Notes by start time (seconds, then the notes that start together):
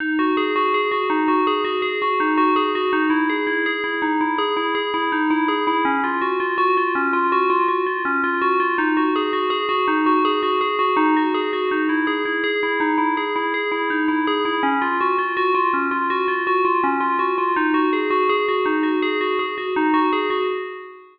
0.00 D#4
0.19 F#4
0.37 G#4
0.56 F#4
0.74 G#4
0.91 F#4
1.10 D#4
1.28 F#4
1.47 G#4
1.64 F#4
1.82 G#4
2.02 F#4
2.20 D#4
2.37 F#4
2.56 G#4
2.75 F#4
2.93 D#4
3.10 E4
3.30 G#4
3.47 E4
3.66 G#4
3.84 E4
4.02 D#4
4.21 E4
4.38 G#4
4.57 E4
4.75 G#4
4.94 E4
5.12 D#4
5.30 E4
5.48 G#4
5.67 E4
5.85 C#4
6.04 F4
6.21 F#4
6.40 F4
6.58 F#4
6.77 F4
6.95 C#4
7.13 F4
7.32 F#4
7.50 F4
7.68 F#4
7.86 F4
8.05 C#4
8.24 F4
8.42 F#4
8.60 F4
8.78 D#4
8.97 F#4
9.16 G#4
9.33 F#4
9.50 G#4
9.69 F#4
9.88 D#4
10.06 F#4
10.25 G#4
10.43 F#4
10.61 G#4
10.79 F#4
10.97 D#4
11.16 F#4
11.34 G#4
11.53 F#4
11.71 D#4
11.89 E4
12.07 G#4
12.25 E4
12.44 G#4
12.63 E4
12.80 D#4
12.98 E4
13.17 G#4
13.36 E4
13.54 G#4
13.72 E4
13.90 D#4
14.08 E4
14.27 G#4
14.45 E4
14.63 C#4
14.82 F4
15.01 F#4
15.18 F4
15.37 F#4
15.55 F4
15.73 C#4
15.91 F4
16.10 F#4
16.28 F4
16.47 F#4
16.65 F4
16.84 C#4
17.00 F4
17.19 F#4
17.38 F4
17.56 D#4
17.74 F#4
17.93 G#4
18.10 F#4
18.29 G#4
18.48 F#4
18.66 D#4
18.83 F#4
19.02 G#4
19.21 F#4
19.39 G#4
19.58 F#4
19.76 D#4
19.94 F#4
20.13 G#4
20.30 F#4